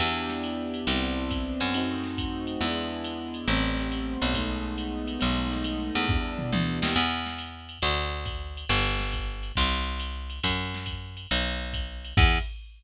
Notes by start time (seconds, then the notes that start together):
0.00 E2 B3 D4 E4 G4, ride
0.29 snare
0.43 hi-hat pedal, ride
0.74 ride
0.87 C2 B3 C4 D4 E4, ride
1.30 kick, hi-hat pedal, ride
1.60 F#2, ride
1.74 A3 C4 D#4 F#4, ride
2.03 snare
2.17 kick, hi-hat pedal, ride
2.47 ride
2.61 E2 G#3 B3 D4 E4, ride
3.04 hi-hat pedal, ride
3.34 ride
3.48 A1 G3 A3 B3 C4, ride
3.77 snare
3.92 hi-hat pedal, ride
4.22 B1, ride
4.34 G#3 A3 B3 D#4, kick, ride
4.78 hi-hat pedal, ride
5.08 ride
5.19 B1 G#3 A3 B3 D#4, ride
5.52 snare
5.64 hi-hat pedal, ride
5.95 E2, ride
6.08 G3 B3 D4 E4, kick, floor tom
6.39 mid tom
6.52 D2, high tom
6.82 D#2, snare
6.95 E2, crash, ride
7.26 snare
7.38 hi-hat pedal, ride
7.69 ride
7.82 D2, ride
8.26 kick, hi-hat pedal, ride
8.57 ride
8.69 G1, ride
9.00 snare
9.12 kick, hi-hat pedal, ride
9.43 ride
9.56 C2, kick, ride
10.00 hi-hat pedal, ride
10.30 ride
10.43 F#2, kick, ride
10.74 snare
10.86 kick, hi-hat pedal, ride
11.17 ride
11.31 B1, ride
11.73 kick, hi-hat pedal, ride
12.05 ride
12.17 E2, kick, crash